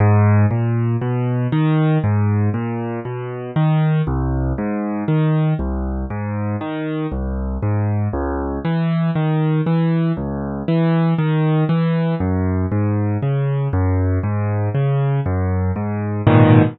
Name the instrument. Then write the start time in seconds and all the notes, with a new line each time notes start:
acoustic grand piano
0.00 G#2
0.51 A#2
1.01 B2
1.52 D#3
2.04 G#2
2.54 A#2
3.05 B2
3.56 D#3
4.07 C2
4.58 G#2
5.08 D#3
5.59 C2
6.10 G#2
6.61 D#3
7.12 C2
7.62 G#2
8.13 C#2
8.65 E3
9.15 D#3
9.66 E3
10.17 C#2
10.68 E3
11.18 D#3
11.69 E3
12.20 F#2
12.72 G#2
13.22 C#3
13.73 F#2
14.23 G#2
14.75 C#3
15.26 F#2
15.76 G#2
16.27 G#2 A#2 B2 D#3